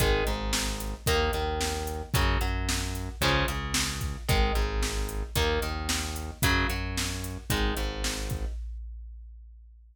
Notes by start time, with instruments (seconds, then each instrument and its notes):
0.00 synth bass 1 G#1, overdriven guitar D#3 G#3, kick, closed hi-hat
0.26 synth bass 1 G#1, overdriven guitar G#2, closed hi-hat
0.53 snare
0.80 closed hi-hat
1.06 synth bass 1 D#2, overdriven guitar D#3 A#3, kick, closed hi-hat
1.33 synth bass 1 D#2, overdriven guitar D#3, closed hi-hat
1.61 snare
1.87 closed hi-hat
2.14 synth bass 1 F#2, overdriven guitar C#3 F#3, kick, closed hi-hat
2.41 synth bass 1 F#2, overdriven guitar F#3, closed hi-hat
2.69 snare
2.95 closed hi-hat
3.21 synth bass 1 C#2, overdriven guitar C#3 F3 G#3, kick, closed hi-hat
3.48 synth bass 1 C#2, overdriven guitar C#3, closed hi-hat
3.74 snare
4.01 kick, closed hi-hat
4.29 synth bass 1 G#1, overdriven guitar D#3 G#3, kick, closed hi-hat
4.55 synth bass 1 G#1, overdriven guitar G#2, closed hi-hat
4.83 snare
5.09 closed hi-hat
5.35 synth bass 1 D#2, overdriven guitar D#3 A#3, kick, closed hi-hat
5.62 synth bass 1 D#2, overdriven guitar D#3, closed hi-hat
5.89 snare
6.16 closed hi-hat
6.42 synth bass 1 F#2, overdriven guitar C#3 F#3, kick, closed hi-hat
6.69 synth bass 1 F#2, overdriven guitar F#3, closed hi-hat
6.97 snare
7.24 closed hi-hat
7.50 synth bass 1 G#1, overdriven guitar D#3 G#3, kick, closed hi-hat
7.77 synth bass 1 G#1, overdriven guitar G#2, closed hi-hat
8.04 snare
8.30 kick, closed hi-hat